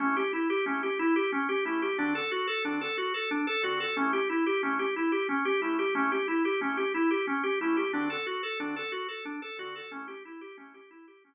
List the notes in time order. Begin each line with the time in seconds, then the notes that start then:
0.00 A3 C#4 E4 G4
0.17 G4
0.33 E4
0.50 G4
0.66 A3 C#4 E4 G4
0.83 G4
0.99 E4
1.16 G4
1.32 C#4
1.49 G4
1.65 A3 C#4 E4 G4
1.82 G4
1.98 D3 C4 D4 F#4 A4
2.15 A4
2.31 F#4
2.47 A4
2.65 D3 C4 D4 F#4 A4
2.81 A4
2.98 F#4
3.14 A4
3.31 D4
3.47 A4
3.63 D3 C4 F#4 A4
3.80 A4
3.97 A3 C#4 E4 G4
4.13 G4
4.29 E4
4.46 G4
4.63 A3 C#4 E4 G4
4.79 G4
4.96 E4
5.12 G4
5.29 C#4
5.45 G4
5.62 A3 C#4 E4 G4
5.79 G4
5.95 A3 C#4 E4 G4
6.12 G4
6.28 E4
6.45 G4
6.61 A3 C#4 E4 G4
6.77 G4
6.94 E4
7.11 G4
7.27 C#4
7.43 G4
7.61 A3 C#4 E4 G4
7.77 G4
7.93 D3 C4 D4 F#4 A4
8.10 A4
8.26 F#4
8.43 A4
8.60 D3 C4 D4 F#4 A4
8.76 A4
8.92 F#4
9.08 A4
9.25 D4
9.42 A4
9.59 D3 C4 F#4 A4
9.76 A4
9.91 A3 C#4 E4 G4
10.08 G4
10.25 E4
10.41 G4
10.57 A3 C#4 E4 G4
10.74 G4
10.91 E4
11.08 G4
11.24 C#4